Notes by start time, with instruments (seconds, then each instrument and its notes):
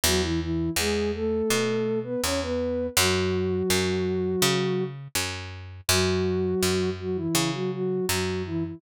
0.04 electric bass (finger) E2, ocarina F#3 F#4
0.23 ocarina E3 E4
0.41 ocarina E3 E4
0.76 electric bass (finger) E2, ocarina G#3 G#4
1.14 ocarina A3 A4
1.50 electric bass (finger) B2
2.04 ocarina B3 B4
2.23 electric bass (finger) E2, ocarina C#4 C#5
2.42 ocarina B3 B4
2.97 electric bass (finger) F#2, ocarina F#3 F#4
3.70 electric bass (finger) F#2
4.42 electric bass (finger) C#3
5.15 electric bass (finger) F#2
5.89 electric bass (finger) F#2, ocarina F#3 F#4
6.62 electric bass (finger) F#2
7.00 ocarina F#3 F#4
7.16 ocarina E3 E4
7.35 electric bass (finger) C#3
7.53 ocarina F#3 F#4
7.73 ocarina F#3 F#4
8.09 electric bass (finger) F#2, ocarina F#3 F#4
8.46 ocarina E3 E4
8.65 ocarina E3 E4